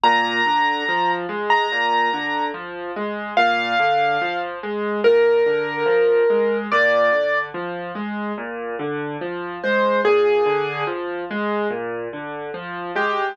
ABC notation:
X:1
M:4/4
L:1/16
Q:1/4=72
K:Eb
V:1 name="Acoustic Grand Piano"
b6 z b5 z4 | f6 z2 B8 | d4 z10 c2 | A4 z10 G2 |]
V:2 name="Acoustic Grand Piano" clef=bass
B,,2 D,2 F,2 A,2 B,,2 D,2 F,2 A,2 | B,,2 D,2 F,2 A,2 B,,2 D,2 F,2 A,2 | B,,2 D,2 F,2 A,2 B,,2 D,2 F,2 A,2 | B,,2 D,2 F,2 A,2 B,,2 D,2 F,2 A,2 |]